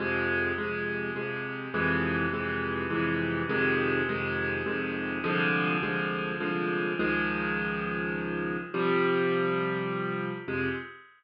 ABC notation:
X:1
M:3/4
L:1/8
Q:1/4=103
K:Fm
V:1 name="Acoustic Grand Piano" clef=bass
[F,,C,A,]2 [F,,C,A,]2 [F,,C,A,]2 | [F,,C,=E,A,]2 [F,,C,E,A,]2 [F,,C,E,A,]2 | [F,,C,E,A,]2 [F,,C,E,A,]2 [F,,C,E,A,]2 | [C,,=D,F,A,]2 [C,,D,F,A,]2 [C,,D,F,A,]2 |
[D,,E,F,A,]6 | [C,F,G,]6 | [F,,C,A,]2 z4 |]